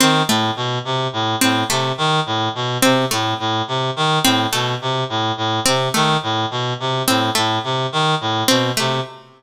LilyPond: <<
  \new Staff \with { instrumentName = "Clarinet" } { \clef bass \time 4/4 \tempo 4 = 106 ees8 a,8 b,8 c8 a,8 a,8 c8 ees8 | a,8 b,8 c8 a,8 a,8 c8 ees8 a,8 | b,8 c8 a,8 a,8 c8 ees8 a,8 b,8 | c8 a,8 a,8 c8 ees8 a,8 b,8 c8 | }
  \new Staff \with { instrumentName = "Harpsichord" } { \time 4/4 c'8 a8 r4. c'8 a8 r8 | r4 c'8 a8 r4. c'8 | a8 r4. c'8 a8 r4 | r8 c'8 a8 r4. c'8 a8 | }
>>